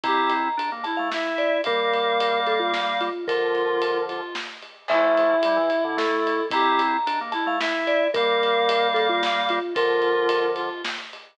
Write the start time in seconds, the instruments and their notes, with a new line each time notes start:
0.03 drawbar organ C4 E4, clarinet G4, vibraphone A#5, kick, ride
0.30 ride
0.57 drawbar organ D4, ride
0.72 drawbar organ A#3
0.84 clarinet E4, vibraphone A5, ride
0.97 drawbar organ A3, vibraphone F5
1.11 drawbar organ E4, clarinet E5, snare
1.38 vibraphone D5, ride
1.64 drawbar organ G3 A#3, vibraphone A#4, clarinet F5, kick, ride
1.93 ride
2.20 ride
2.47 vibraphone A4, ride
2.60 vibraphone F4
2.74 snare
3.01 vibraphone F4, ride
3.27 drawbar organ D3 F3, clarinet F4, vibraphone A#4, kick, ride
3.55 ride
3.82 ride
4.09 clarinet F4, ride
4.35 snare
4.62 ride
4.88 drawbar organ F3 A3, clarinet E4, vibraphone E5, kick, crash
5.17 ride
5.43 drawbar organ G3, ride
5.56 drawbar organ E3
5.70 ride
5.84 drawbar organ D3
5.97 drawbar organ A3, vibraphone A4, snare
6.27 ride
6.50 drawbar organ C4 E4, clarinet G4, vibraphone A#5, kick, ride
6.79 ride
7.07 drawbar organ D4, ride
7.21 drawbar organ A#3
7.32 clarinet E4, vibraphone A5, ride
7.46 drawbar organ A3, vibraphone F5
7.60 drawbar organ E4, clarinet E5, snare
7.87 vibraphone D5, ride
8.14 drawbar organ G3 A#3, vibraphone A#4, clarinet F5, kick, ride
8.43 ride
8.69 ride
8.94 vibraphone A4, ride
9.09 vibraphone F4
9.23 snare
9.49 vibraphone F4, ride
9.74 drawbar organ D3 F3, clarinet F4, vibraphone A#4, kick, ride
10.02 ride
10.29 ride
10.56 clarinet F4, ride
10.84 snare
11.13 ride